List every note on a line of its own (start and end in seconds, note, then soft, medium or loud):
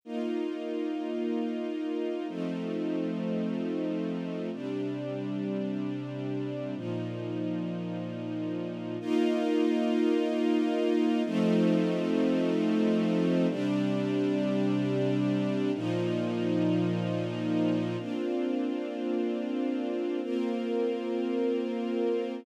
0.05 2.27 A#3 medium
0.05 2.27 D#4 medium
0.05 2.27 F4 medium
2.28 4.50 F3 medium
2.28 4.50 A3 medium
2.28 4.50 C4 medium
2.28 4.50 D#4 medium
4.52 6.75 C3 medium
4.52 6.75 G3 medium
4.52 6.75 D4 medium
6.75 8.97 A#2 medium
6.75 8.97 F3 medium
6.75 8.97 D#4 medium
9.00 11.23 A#3 loud
9.00 11.23 D#4 loud
9.00 11.23 F4 loud
11.25 13.47 F3 loud
11.25 13.47 A3 loud
11.25 13.47 C4 loud
11.25 13.47 D#4 loud
13.49 15.71 C3 loud
13.49 15.71 G3 loud
13.49 15.71 D4 loud
15.74 17.96 A#2 loud
15.74 17.96 F3 loud
15.74 17.96 D#4 loud
17.99 20.21 A#3 medium
17.99 20.21 C4 medium
17.99 20.21 D4 medium
17.99 20.21 F4 medium
20.23 22.45 A#3 medium
20.23 22.45 C4 medium
20.23 22.45 F4 medium
20.23 22.45 A#4 medium